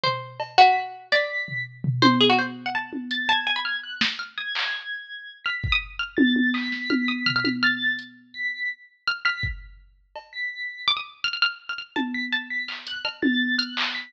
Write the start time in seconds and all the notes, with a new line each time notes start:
0.04 C5, floor tom
0.40 cowbell
0.58 F#4 B6
1.12 D5 B6, snare
1.48 floor tom
1.84 floor tom
2.02 C5, high tom
2.21 G#4
2.30 F#4
2.39 C5
2.66 F#5
2.75 A5
2.93 high tom
3.11 A6, closed hi-hat
3.28 A5 G#6
3.47 G#5
3.56 B5
3.65 F6
3.84 F#6
4.01 snare
4.19 F6
4.38 D#6 G#6
4.55 clap
5.45 F6 B6
5.64 kick
5.72 D#6
5.99 F6
6.17 A6, high tom
6.36 high tom
6.54 D#6 B6, clap
6.72 snare
6.90 F6, high tom
7.08 D#6
7.26 F6, floor tom
7.36 F6
7.45 F6, high tom
7.63 F6 A6
7.99 closed hi-hat
8.34 B6
9.08 F6
9.25 F6 B6
9.43 kick
10.16 cowbell
10.33 B6
10.88 D6
10.97 D#6
11.24 F6
11.33 F6
11.42 F6
11.69 F6
11.78 F6
11.96 A5, high tom
12.14 B6
12.33 A5
12.50 B6
12.68 F6, clap
12.87 F#6, closed hi-hat
13.05 F6, cowbell
13.22 A6, high tom
13.59 F6 F#6, closed hi-hat
13.77 clap
13.95 B6